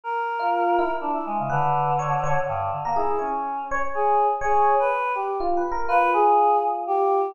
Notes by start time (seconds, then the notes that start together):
0.04 A#4
0.39 F4
0.79 E4
1.01 D4
1.13 E4
1.26 G#3
1.39 C#3
1.49 D3 B4
1.99 C#5
2.24 C#5
2.47 G2
2.72 D3
2.85 A#3 A#4
2.96 E4 G#4
3.19 C#4 C#5
3.71 C#5
3.94 G#4
4.41 G#4 C#5
4.79 B4
5.15 G4
5.40 F4
5.57 B4
5.72 A#4
5.88 F4 B4
6.13 G#4
6.87 G4